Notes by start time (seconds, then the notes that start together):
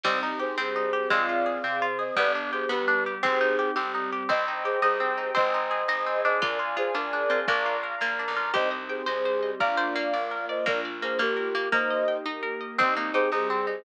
0.03 C2 G3 C4 D#4 G4 C5 D#5, kick, crash
0.23 D#4
0.39 G4 G#4 C5
0.58 G2 G3 C4 G4 G#4 C5
0.76 D#4
0.93 G4
1.10 F2 G#3 C4 F4 G#4 D5 F5, kick
1.29 F4
1.46 G#4
1.64 C3 C4 G#4 C5
1.82 F4
1.99 G#4 C5 D#5
2.16 G1 G3 B3 D4 G4 B4 D5, kick
2.35 D4
2.52 G4 G#4 C5
2.69 D2 G3 B3 G4 B4
2.88 D4
3.06 G4
3.23 G1 C4 D#4 G4 G#4 C5, kick
3.41 D#4
3.59 G4
3.76 G1 G3 C4 G4
3.94 D#4
4.12 G4
4.29 C2 C4 C5 D#5 G5, kick
4.48 D#4
4.64 G4 G#4 C5
4.82 C2 D#4 G4 G#4 C5 D#5 G5
5.00 C4
5.17 D#4
5.35 G#1 C4 C5 D#5 G#5, kick
5.54 D#4
5.71 G#4
5.88 G#1 D#4 G#4 C5 D#5 G#5
6.06 C4
6.24 D4 C5 D#5
6.41 D2 F4 A#4 D5 F5 G#5, kick
6.59 F4
6.76 F4 G#4 C5
6.94 D2 D4 F4 G#4 A#4 D5 G#5
7.13 D4
7.30 C4 F4
7.47 A#1 A#3 D4 A#4 D5 F5 A#5, kick
7.66 F4
7.83 A#4
8.01 A#1 A#3 F4 A#4 D5 A#5
8.19 D4
8.28 B1
8.36 F4
8.53 C2 C4 D#4 G4 C5 D#5, kick
8.71 D#5
8.89 G#4 C5 G5
9.06 C2 G3 C4 G4 G#4 C5 D#5
9.25 C5
9.43 D#5
9.60 A#1 A#3 D4 F4 A#4 D5 F5, kick
9.77 C5 D5
9.96 A#3 F5
10.13 A#1 A#3 F4 A#4 D5
10.31 A#4
10.49 C5 D5 D#5
10.66 A#1 A#3 D4 F4 A#4 D5, kick
10.85 D5
11.02 A#3 G#4 C5 F5
11.19 A#1 A#3 F4 G4 A#4 D5
11.37 A#4
11.55 A#3 D5
11.72 A#3 D#4 G4 A#4 C5 D#5, kick
11.90 D#5
12.08 G5
12.26 A#3 D#4 G4 A#4 D#5
12.43 A#4
12.61 D#5
12.78 C2 C4 D#4 G4 C5 D#5, kick
12.96 A#3 D#4
13.14 D#4 G4 G#4 C5
13.32 C2 G3 C4 D#4 G4 G#4 C5
13.50 C4
13.67 D#4